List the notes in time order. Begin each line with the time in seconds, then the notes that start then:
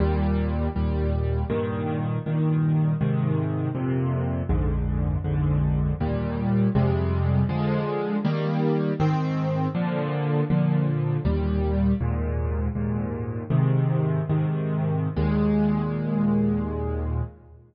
0.00 D#2 A#2 G3
0.76 D#2 A#2 G3
1.50 G2 A#2 D#3
2.26 G2 A#2 D#3
3.01 G#2 C3 D#3
3.75 F2 A#2 C3
4.49 A#1 F2 G#2 D3
5.24 A#1 F2 G#2 D3
6.00 D#2 A#2 G3
6.75 F2 C3 G3 G#3
7.49 D3 F3 G#3
8.25 D#3 G3 A#3
9.00 G#2 D#3 C4
9.75 A#2 D3 F3
10.50 A#2 D3 F3
11.25 D#2 A#2 G3
12.01 D#2 G#2 A#2
12.75 D#2 G#2 A#2
13.50 G#2 C3 D#3
14.29 G#2 C3 D#3
15.16 D#2 A#2 G#3